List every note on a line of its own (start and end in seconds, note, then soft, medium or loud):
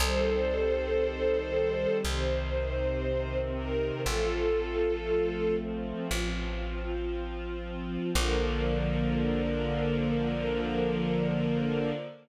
0.00 1.87 C2 medium
0.00 2.01 D#3 medium
0.00 2.01 G3 medium
0.00 2.01 C4 medium
0.00 1.97 A4 loud
0.00 1.97 C5 loud
2.03 3.92 C2 medium
2.03 4.04 C3 medium
2.03 4.04 D#3 medium
2.03 4.04 C4 medium
2.03 3.38 C5 loud
3.56 4.01 A#4 loud
4.06 5.93 A1 medium
4.06 6.07 F3 medium
4.06 6.07 A3 medium
4.06 6.07 C4 medium
4.06 5.55 F4 loud
4.06 5.55 A4 loud
6.10 7.98 A1 medium
6.10 8.11 F3 medium
6.10 8.11 C4 medium
6.10 8.11 F4 medium
8.13 11.92 A#1 loud
8.13 11.92 D3 loud
8.13 11.92 F3 loud
8.13 11.92 A#3 medium
8.13 11.90 A#4 loud